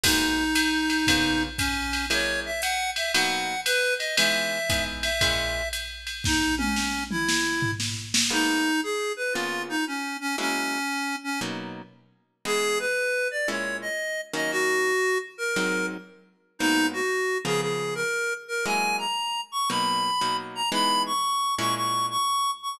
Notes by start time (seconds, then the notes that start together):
0.04 G#3 A#3 B3 D#4 F#4, kick, crash, ride
0.55 hi-hat pedal, ride
0.90 ride
1.07 C#3 A#3 B3 F4, kick, ride
1.58 C#4, kick, hi-hat pedal, ride
1.93 ride
2.10 F#3 G#3 A#3 E4 C#5, ride
2.46 E5
2.62 F#5, hi-hat pedal, ride
2.96 E5, ride
3.14 B2 F#3 A#3 D#4 F#5, ride
3.65 B4, hi-hat pedal, ride
3.99 D#5, ride
4.17 E3 G#3 B3 D#4 E5, ride
4.70 E3 G#3 B3 D#4, kick, hi-hat pedal, ride
5.03 E5, ride
5.21 A#2 G#3 C#4 E4, kick, ride
5.73 hi-hat pedal, ride
6.07 ride
6.24 D#4, kick, snare
6.58 C#4, high tom
6.76 snare
7.11 E4, mid tom
7.29 snare
7.62 floor tom
7.80 snare
8.14 snare
8.30 G#3 A#3 B3 D#4 F#4
8.83 G#4
9.17 B4
9.33 C#3 A#3 B3 F4
9.69 D#4
9.87 C#4
10.21 C#4
10.38 F#3 G#3 A#3 C#4 E4
11.24 C#4
11.41 B2 F#3 A#3 D#4
12.45 E3 G#3 B3 D#4 G#4
12.80 B4
13.31 D5
13.48 A#2 G#3 C#4 E4 C#5
13.82 D#5
14.34 D#3 F#3 A#3 C#4 D#5
14.51 F#4
15.38 A#4
15.56 G#2 F#3 C4 D#4
16.59 G#2 F#3 A#3 B3 D#4
16.93 F#4
17.45 C#3 F3 A#3 B3 G#4
17.61 G#4
17.95 A#4
18.48 A#4
18.66 F#3 G#3 A#3 E4 G#5
18.98 A#5
19.52 C#6
19.70 B2 F#3 A#3 D#4 B5
20.21 B2 F#3 A#3 D#4
20.55 A#5
20.72 E3 G#3 B3 D#4 B5
21.06 C#6
21.59 A#2 G#3 C#4 E4 C#6
21.76 C#6
22.11 C#6
22.63 C#6